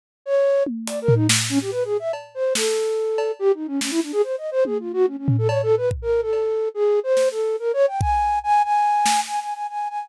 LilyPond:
<<
  \new Staff \with { instrumentName = "Flute" } { \time 6/4 \tempo 4 = 143 r8 des''4 r8 \tuplet 3/2 { d''8 bes'8 ees'8 } r8 des'16 g'16 \tuplet 3/2 { b'8 aes'8 e''8 } r8 c''8 | a'2 \tuplet 3/2 { g'8 ees'8 des'8 } des'16 e'16 d'16 aes'16 \tuplet 3/2 { c''8 ees''8 c''8 aes'8 f'8 ges'8 } | des'16 des'8 a'16 \tuplet 3/2 { des''8 a'8 b'8 } r16 bes'8 a'4~ a'16 \tuplet 3/2 { aes'4 c''4 a'4 } | \tuplet 3/2 { bes'8 des''8 g''8 } aes''4 aes''8 aes''4. \tuplet 3/2 { aes''8 aes''8 aes''8 } aes''8 aes''8 | }
  \new DrumStaff \with { instrumentName = "Drums" } \drummode { \time 6/4 r4 r8 tommh8 hh8 tomfh8 sn4 r4 cb4 | sn4 r8 cb8 r4 sn4 r4 tommh4 | r8 tomfh8 cb4 bd4 cb4 r4 sn4 | r4 bd4 r4 r8 sn8 r4 r4 | }
>>